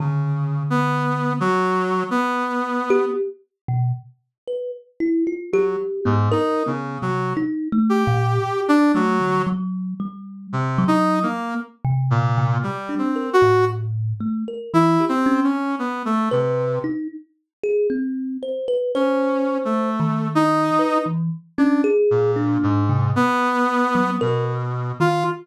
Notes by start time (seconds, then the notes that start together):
0.00 C#3 D3
0.70 B3
1.40 F#3
2.11 B3
2.90 G4
3.68 B2
4.48 B4
5.00 E4
5.27 F4
5.53 F#3 G4
6.05 G#2 B3
6.32 D#4 A#4
6.66 C#3 B3
7.02 C3 F#3
7.37 D#4
7.72 A3
7.89 G4
8.07 A#2
8.68 D4
8.95 F#3 A3
9.20 D3
9.47 F#3
10.00 G3
10.53 C3
10.78 F#3
10.88 D#4
11.23 A#3
11.85 C3
12.11 A#2
12.38 C3
12.63 G3
12.89 D4
12.98 C4
13.16 A#4
13.33 F#4
13.42 A2
14.20 A3
14.48 A#4
14.74 E3 E4
15.00 G4
15.09 C4
15.26 C#4
15.44 C#4
15.79 B3
16.05 A3
16.31 C3 B4
16.84 D#4
17.63 G#4
17.90 C4
18.43 C5
18.68 B4
18.95 C#4 C5
19.65 A3
20.00 D#3
20.35 D#4
20.79 B4
21.06 E3
21.58 C#4 D4
21.84 G#4
22.11 A#2
22.36 D4
22.63 G#2
22.89 C3
23.16 B3
23.95 F#3
24.21 B2 A#4
25.00 D#3 F4